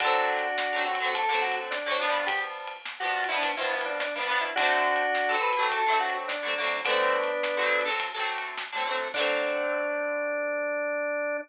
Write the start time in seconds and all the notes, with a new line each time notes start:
0.00 D3 F#3 D4 F#4, kick, ride
0.05 A3 C4
0.38 kick, ride
0.58 snare
0.73 D3 F#3 A3
0.78 C4
0.86 F#4
0.95 ride
1.00 D3 F#3 A3
1.05 C4
1.14 A4, kick, ride
1.29 D3 F#3 A3
1.34 C4
1.42 F#4
1.52 ride
1.71 D4, snare
1.86 D3 F#3 A3
1.91 C4
1.99 G2 F3 B3
2.04 D4
2.10 ride
2.27 G4, kick, ride
2.67 ride
2.85 snare
3.00 G2 F3 B3 F#4
3.05 D4
3.24 ride
3.28 G2 F3 B3 E4
3.33 D4
3.43 kick, ride
3.57 G2 F3 B3 E4
3.62 D4, kick
3.71 E4
3.81 ride
3.85 D4
4.00 D4, snare
4.16 G2 F3 B3
4.21 D4
4.27 G2 F3 B3
4.32 D4
4.38 E4, ride
4.56 D3 F#3 D4 F#4, kick, ride
4.60 A3 C4
4.95 kick, ride
5.15 snare
5.29 D3 F#3 A3
5.34 C4
5.41 B4
5.53 ride
5.57 D3 F#3 A3
5.62 C4
5.71 A4, kick, ride
5.86 D3 F#3 A3
5.91 C4
6.00 F#4
6.10 ride
6.28 D4, snare
6.43 D3 F#3 A3
6.48 C4
6.58 D3 F#3 A3
6.63 C4, ride
6.85 D3 F#3 A3 B3 D4, kick, ride
6.90 C4
7.24 ride
7.43 snare
7.57 D3 F#3 A3
7.62 C4
7.81 ride
7.85 D3 F#3 A3
7.90 C4
8.00 kick, ride
8.14 D3 F#3 A3
8.19 C4, kick
8.38 ride
8.58 snare
8.72 D3 F#3 A3
8.77 C4
8.85 D3 F#3 A3
8.90 C4
8.95 ride
9.14 D3 F#3 D4, kick, crash
9.19 A3 C4